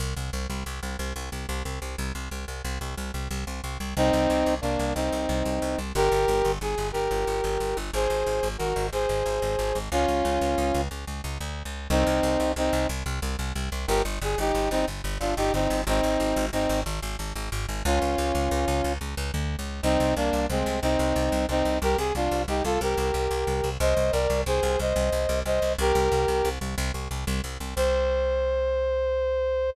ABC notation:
X:1
M:12/8
L:1/16
Q:3/8=121
K:Cm
V:1 name="Brass Section"
z24 | z24 | [CE]8 [B,D]4 [CE]12 | [GB]8 A4 [GB]12 |
[Ac]8 [_GB]4 [Ac]12 | [_DF]12 z12 | [CE]8 [CE]4 z12 | [GB]2 z2 A2 [EG]4 [CE]2 z4 [DF]2 [EG]2 [CE]4 |
[CE]8 [CE]4 z12 | [_DF]14 z10 | [CE]4 [B,D]4 [A,C]4 [CE]8 [CE]4 | [GB]2 A2 [DF]4 [EG]2 [F=A]2 [GB]12 |
[ce]4 [Bd]4 [Ac]4 [ce]8 [ce]4 | [GB]10 z14 | c24 |]
V:2 name="Electric Bass (finger)" clef=bass
C,,2 C,,2 C,,2 C,,2 C,,2 C,,2 C,,2 C,,2 C,,2 C,,2 C,,2 C,,2 | C,,2 C,,2 C,,2 C,,2 C,,2 C,,2 C,,2 C,,2 C,,2 C,,2 C,,2 C,,2 | C,,2 C,,2 C,,2 C,,2 C,,2 C,,2 C,,2 C,,2 C,,2 C,,2 C,,2 C,,2 | G,,,2 G,,,2 G,,,2 G,,,2 G,,,2 G,,,2 G,,,2 G,,,2 G,,,2 G,,,2 G,,,2 G,,,2 |
A,,,2 A,,,2 A,,,2 A,,,2 A,,,2 A,,,2 A,,,2 A,,,2 A,,,2 A,,,2 A,,,2 A,,,2 | _D,,2 D,,2 D,,2 D,,2 D,,2 D,,2 D,,2 D,,2 D,,2 =D,,3 _D,,3 | C,,2 C,,2 C,,2 C,,2 C,,2 C,,2 C,,2 C,,2 C,,2 C,,2 C,,2 C,,2 | G,,,2 G,,,2 G,,,2 G,,,2 G,,,2 G,,,2 G,,,2 G,,,2 G,,,2 G,,,2 G,,,2 G,,,2 |
A,,,2 A,,,2 A,,,2 A,,,2 A,,,2 A,,,2 A,,,2 A,,,2 A,,,2 A,,,2 A,,,2 A,,,2 | _D,,2 D,,2 D,,2 D,,2 D,,2 D,,2 D,,2 D,,2 D,,2 =D,,3 _D,,3 | C,,2 C,,2 C,,2 C,,2 C,,2 C,,2 C,,2 C,,2 C,,2 C,,2 C,,2 C,,2 | C,,2 C,,2 C,,2 C,,2 C,,2 C,,2 C,,2 C,,2 C,,2 C,,2 C,,2 C,,2 |
C,,2 C,,2 C,,2 C,,2 C,,2 C,,2 C,,2 C,,2 C,,2 C,,2 C,,2 C,,2 | C,,2 C,,2 C,,2 C,,2 C,,2 C,,2 C,,2 C,,2 C,,2 C,,2 C,,2 C,,2 | C,,24 |]